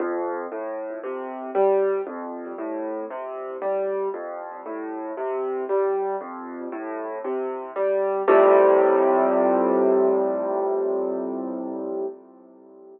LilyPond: \new Staff { \clef bass \time 4/4 \key f \major \tempo 4 = 58 f,8 a,8 c8 g8 f,8 a,8 c8 g8 | f,8 a,8 c8 g8 f,8 a,8 c8 g8 | <f, a, c g>1 | }